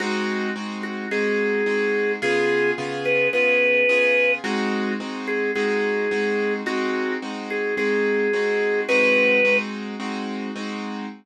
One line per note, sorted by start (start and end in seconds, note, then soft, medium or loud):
0.00 0.50 G#3 loud
0.00 0.50 C4 loud
0.00 0.50 D#4 loud
0.00 0.50 F#4 loud
0.00 0.48 F#4 loud
0.56 1.06 G#3 medium
0.56 1.06 C4 loud
0.56 1.06 D#4 medium
0.56 1.06 F#4 loud
0.83 1.07 F#4 medium
1.11 1.61 G#3 loud
1.11 1.61 C4 medium
1.11 1.61 D#4 loud
1.11 1.61 F#4 loud
1.11 2.12 G#4 loud
1.66 2.16 G#3 medium
1.66 2.16 C4 loud
1.66 2.16 D#4 loud
1.66 2.16 F#4 loud
2.22 2.72 C#3 loud
2.22 2.72 B3 loud
2.22 2.72 F4 loud
2.22 2.72 G#4 loud
2.22 2.71 G#4 loud
2.78 3.28 C#3 loud
2.78 3.28 B3 loud
2.78 3.28 F4 loud
2.78 3.28 G#4 loud
3.05 3.28 B4 medium
3.33 3.83 C#3 loud
3.33 3.83 B3 loud
3.33 3.83 F4 loud
3.33 3.83 G#4 medium
3.33 4.32 B4 loud
3.89 4.39 C#3 medium
3.89 4.39 B3 medium
3.89 4.39 F4 loud
3.89 4.39 G#4 loud
4.44 4.94 G#3 loud
4.44 4.94 C4 loud
4.44 4.94 D#4 loud
4.44 4.94 F#4 loud
4.44 4.90 F#4 loud
5.00 5.50 G#3 medium
5.00 5.50 C4 loud
5.00 5.50 D#4 loud
5.00 5.50 F#4 loud
5.27 5.51 G#4 medium
5.55 6.06 G#3 loud
5.55 6.06 C4 loud
5.55 6.06 D#4 loud
5.55 6.06 F#4 loud
5.55 6.53 G#4 medium
6.11 6.61 G#3 loud
6.11 6.61 C4 medium
6.11 6.61 D#4 loud
6.11 6.61 F#4 loud
6.66 7.16 G#3 loud
6.66 7.16 C4 loud
6.66 7.16 D#4 loud
6.66 7.16 F#4 loud
6.66 7.12 F#4 loud
7.22 7.72 G#3 medium
7.22 7.72 C4 medium
7.22 7.72 D#4 loud
7.22 7.72 F#4 loud
7.50 7.75 G#4 medium
7.77 8.27 G#3 medium
7.77 8.27 C4 loud
7.77 8.27 D#4 loud
7.77 8.27 F#4 medium
7.77 8.80 G#4 loud
8.33 8.83 G#3 medium
8.33 8.83 C4 loud
8.33 8.83 D#4 loud
8.33 8.83 F#4 loud
8.89 9.39 G#3 loud
8.89 9.39 C4 loud
8.89 9.39 D#4 loud
8.89 9.39 F#4 loud
8.89 9.56 B4 loud
9.45 9.95 G#3 loud
9.45 9.95 C4 loud
9.45 9.95 D#4 loud
9.45 9.95 F#4 loud
10.00 10.50 G#3 loud
10.00 10.50 C4 loud
10.00 10.50 D#4 loud
10.00 10.50 F#4 loud
10.56 11.06 G#3 medium
10.56 11.06 C4 loud
10.56 11.06 D#4 loud
10.56 11.06 F#4 loud